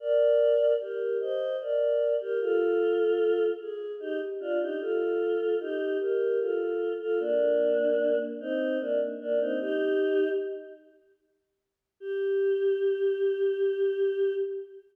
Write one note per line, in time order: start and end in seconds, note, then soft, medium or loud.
0.00 0.72 A#4 medium
0.00 0.72 D5 medium
0.80 1.17 G4 medium
0.80 1.17 A#4 medium
1.20 1.56 C5 medium
1.20 1.56 D#5 medium
1.60 2.14 A#4 medium
1.60 2.14 D5 medium
2.20 2.39 G4 medium
2.20 2.39 A#4 medium
2.41 3.45 F4 medium
2.41 3.45 A4 medium
3.60 3.93 G#4 medium
4.00 4.19 D#4 medium
4.00 4.19 G4 medium
4.40 4.59 D4 medium
4.40 4.59 F4 medium
4.60 4.79 D#4 medium
4.60 4.79 G4 medium
4.80 5.55 F4 medium
4.80 5.55 A4 medium
5.60 5.97 D#4 medium
5.60 5.97 G4 medium
6.00 6.39 G4 medium
6.00 6.39 A#4 medium
6.40 6.93 F4 medium
6.40 6.93 A4 medium
7.00 7.19 F4 medium
7.00 7.19 A4 medium
7.20 8.17 A#3 medium
7.20 8.17 D4 medium
8.41 8.78 C4 medium
8.41 8.78 D#4 medium
8.80 8.99 A#3 medium
8.80 8.99 D4 medium
9.20 9.39 A#3 medium
9.20 9.39 D4 medium
9.40 9.59 C4 medium
9.40 9.59 D#4 medium
9.60 10.29 D#4 medium
9.60 10.29 G4 loud
12.00 14.33 G4 loud